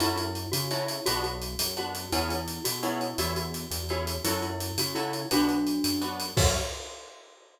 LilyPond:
<<
  \new Staff \with { instrumentName = "Glockenspiel" } { \time 6/8 \key fis \minor \tempo 4. = 113 e'8 e'4 fis'8 e'4 | fis'8 fis'4. fis'4 | e'8 e'4 fis'8 e'4 | fis'8 fis'4. fis'4 |
e'8 e'4 fis'8 e'4 | <d' fis'>2~ <d' fis'>8 r8 | fis'4. r4. | }
  \new Staff \with { instrumentName = "Acoustic Guitar (steel)" } { \time 6/8 \key fis \minor <cis' e' fis' a'>2 <cis' e' fis' a'>4 | <b d' fis'>2 <b d' fis'>4 | <b cis' e' gis'>2 <b cis' e' gis'>4 | <cis' e' gis' a'>2 <cis' e' gis' a'>4 |
<cis' e' fis' a'>2 <cis' e' fis' a'>4 | <b d' fis'>2 <b d' fis'>4 | <cis' e' fis' a'>4. r4. | }
  \new Staff \with { instrumentName = "Synth Bass 1" } { \clef bass \time 6/8 \key fis \minor fis,4. cis4. | b,,4. fis,4. | e,4. b,4. | e,4. e,4. |
fis,4. cis4. | b,,4. fis,4. | fis,4. r4. | }
  \new DrumStaff \with { instrumentName = "Drums" } \drummode { \time 6/8 hh8 hh8 hh8 hh8 hh8 hh8 | hh8 hh8 hh8 hh8 hh8 hh8 | hh8 hh8 hh8 hh8 hh8 hh8 | hh8 hh8 hh8 hh8 hh8 hh8 |
hh8 hh8 hh8 hh8 hh8 hh8 | hh8 hh8 hh8 hh8 hh8 hh8 | <cymc bd>4. r4. | }
>>